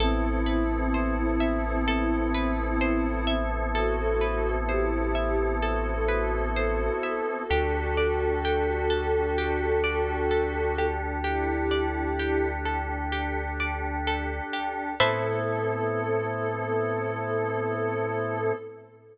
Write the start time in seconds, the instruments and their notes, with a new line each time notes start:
0.00 synth bass 2 A1, drawbar organ B3 C4 E4 A4, ocarina C4 E4, orchestral harp A4
0.46 orchestral harp B4
0.94 orchestral harp C5
1.40 orchestral harp E5
1.88 orchestral harp A4
2.34 orchestral harp B4
2.81 orchestral harp C5
3.27 orchestral harp E5
3.74 ocarina F#4 A4, orchestral harp A4
4.21 orchestral harp B4
4.68 ocarina E4 G4, orchestral harp C5
5.15 orchestral harp E5
5.62 ocarina F#4 A4, orchestral harp A4
6.08 orchestral harp B4
6.56 orchestral harp C5
7.03 orchestral harp E5
7.48 synth bass 2 D2, drawbar organ D4 G4 A4, ocarina F#4 A4, orchestral harp G4
7.97 orchestral harp D5
8.45 orchestral harp G4
8.90 orchestral harp A4
9.38 orchestral harp G4
9.84 orchestral harp D5
10.31 orchestral harp A4
10.78 orchestral harp G4
11.24 ocarina E4 G4, orchestral harp G4
11.71 orchestral harp D5
12.19 orchestral harp G4
12.65 orchestral harp A4
13.12 orchestral harp G4
13.60 orchestral harp D5
14.07 orchestral harp A4
14.53 orchestral harp G4
15.00 synth bass 2 A2, drawbar organ B3 C4 E4 A4, orchestral harp A4 B4 C5 E5, ocarina A4